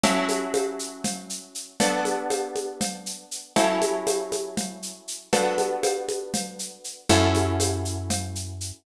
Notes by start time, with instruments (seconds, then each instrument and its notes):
0.03 acoustic guitar (steel) F#3 C#4 E4 A4, cowbell, low conga, shaker
0.29 high conga, shaker
0.54 cowbell, high conga, shaker
0.79 shaker
1.04 cowbell, low conga, shaker
1.30 shaker
1.55 shaker
1.80 acoustic guitar (steel) B3 D4 F#4 A4, cowbell, low conga, shaker
2.05 high conga, shaker
2.30 cowbell, high conga, shaker
2.56 high conga, shaker
2.81 cowbell, low conga, shaker
3.06 shaker
3.31 shaker
3.56 acoustic guitar (steel) F#3 C#4 E4 A4, cowbell, low conga, shaker
3.82 high conga, shaker
4.07 cowbell, high conga, shaker
4.32 high conga, shaker
4.57 cowbell, low conga, shaker
4.82 shaker
5.08 shaker
5.33 acoustic guitar (steel) B3 D4 F#4 A4, cowbell, low conga, shaker
5.58 high conga, shaker
5.83 cowbell, high conga, shaker
6.09 high conga, shaker
6.34 cowbell, low conga, shaker
6.59 shaker
6.84 shaker
7.09 electric bass (finger) F#2, acoustic guitar (steel) C#4 E4 F#4 A4, cowbell, low conga, shaker
7.35 high conga, shaker
7.60 cowbell, high conga, shaker
7.85 shaker
8.10 cowbell, low conga, shaker
8.35 shaker
8.61 shaker